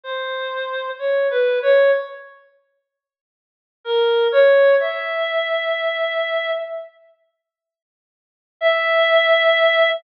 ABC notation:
X:1
M:7/8
L:1/8
Q:1/4=63
K:none
V:1 name="Clarinet"
c2 (3_d B d z3 | z _B _d e4 | z4 e3 |]